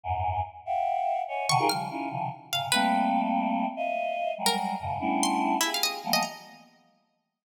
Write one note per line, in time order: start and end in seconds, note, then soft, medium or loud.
0.04 0.41 E2 medium
0.04 0.41 F#2 medium
0.04 0.41 G#2 medium
0.66 1.22 E5 loud
0.66 1.22 F5 loud
0.66 1.22 F#5 loud
0.66 1.22 G5 loud
1.28 1.46 C#5 medium
1.28 1.46 D#5 medium
1.28 1.46 E5 medium
1.28 1.46 F#5 medium
1.28 1.46 G#5 medium
1.49 1.58 B2 loud
1.49 1.58 C3 loud
1.49 1.58 D3 loud
1.49 1.58 D#3 loud
1.49 1.68 C#6 loud
1.59 1.68 D#4 loud
1.59 1.68 F4 loud
1.59 1.68 G4 loud
1.59 1.68 G#4 loud
1.59 1.68 A#4 loud
1.69 1.88 C#3 medium
1.69 1.88 D#3 medium
1.69 1.88 F3 medium
1.69 1.88 G3 medium
1.69 2.25 F6 loud
1.90 2.09 C#4 medium
1.90 2.09 D#4 medium
1.90 2.09 E4 medium
1.90 2.09 F4 medium
2.10 2.29 B2 medium
2.10 2.29 C3 medium
2.10 2.29 C#3 medium
2.10 2.29 D#3 medium
2.10 2.29 F3 medium
2.52 2.71 G#2 medium
2.52 2.71 A#2 medium
2.52 2.71 C3 medium
2.52 2.71 C#3 medium
2.52 2.71 F5 medium
2.72 3.66 G3 loud
2.72 3.66 A3 loud
2.72 3.66 A#3 loud
2.72 3.66 C4 loud
2.72 3.09 B4 medium
3.76 4.32 D#5 loud
3.76 4.32 E5 loud
3.76 4.32 F5 loud
4.38 4.75 F#3 medium
4.38 4.75 G3 medium
4.38 4.75 G#3 medium
4.46 4.55 A#4 medium
4.79 4.98 F2 medium
4.79 4.98 F#2 medium
4.79 4.98 G#2 medium
4.79 4.98 A2 medium
4.79 4.98 B2 medium
4.79 4.98 C#3 medium
5.00 5.56 G3 medium
5.00 5.56 A3 medium
5.00 5.56 B3 medium
5.00 5.56 C#4 medium
5.00 5.56 D4 medium
5.00 5.56 E4 medium
5.23 5.60 C6 loud
5.61 5.70 E4 medium
5.61 5.99 F4 soft
5.61 5.99 G4 soft
5.61 5.99 G#4 soft
5.74 5.84 F5 medium
5.83 5.92 D#5 loud
6.04 6.22 E3 medium
6.04 6.22 F3 medium
6.04 6.22 G3 medium
6.04 6.22 A3 medium
6.04 6.22 A#3 medium
6.04 6.22 B3 medium
6.13 6.22 D#5 loud
6.23 7.34 A#5 medium